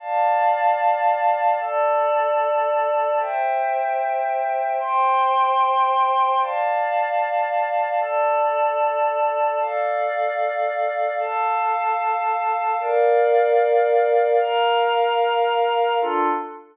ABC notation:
X:1
M:4/4
L:1/8
Q:1/4=75
K:Dm
V:1 name="Pad 5 (bowed)"
[dfa]4 [Ada]4 | [ceg]4 [cgc']4 | [dfa]4 [Ada]4 | [Adf]4 [Afa]4 |
[Bdf]4 [Bfb]4 | [DFA]2 z6 |]